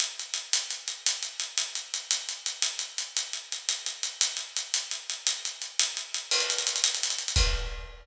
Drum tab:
CC |------------|------------|------------|------------|
HH |x-x-x-x-x-x-|x-x-x-x-x-x-|x-x-x-x-x-x-|x-x-x-x-x-x-|
BD |------------|------------|------------|------------|

CC |------------|------------|x-----------|x-----------|
HH |x-x-x-x-x-x-|x-x-x-x-x-x-|-xxxxxxxxxxx|------------|
BD |------------|------------|------------|o-----------|